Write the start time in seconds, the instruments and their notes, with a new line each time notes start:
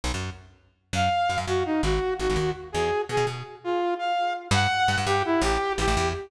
0.04 electric bass (finger) B1
0.14 electric bass (finger) F#2
0.93 electric bass (finger) F#2, lead 2 (sawtooth) F5
1.29 electric bass (finger) F#2
1.38 electric bass (finger) F#2
1.47 electric bass (finger) F#2, lead 2 (sawtooth) F#4
1.65 lead 2 (sawtooth) D#4
1.83 electric bass (finger) G#1, lead 2 (sawtooth) F#4
2.19 electric bass (finger) G#1, lead 2 (sawtooth) F#4
2.30 electric bass (finger) G#1
2.36 electric bass (finger) D#2
2.72 electric bass (finger) E2, lead 2 (sawtooth) G#4
3.09 electric bass (finger) B2, lead 2 (sawtooth) G#4
3.17 electric bass (finger) B2
3.27 electric bass (finger) B2
3.64 lead 2 (sawtooth) F4
3.99 lead 2 (sawtooth) F5
4.51 electric bass (finger) G2, lead 2 (sawtooth) F#5
4.88 electric bass (finger) G2
4.98 electric bass (finger) G2
5.06 electric bass (finger) G2, lead 2 (sawtooth) G4
5.25 lead 2 (sawtooth) E4
5.42 electric bass (finger) A1, lead 2 (sawtooth) G4
5.78 electric bass (finger) A1, lead 2 (sawtooth) G4
5.88 electric bass (finger) A1
5.97 electric bass (finger) E2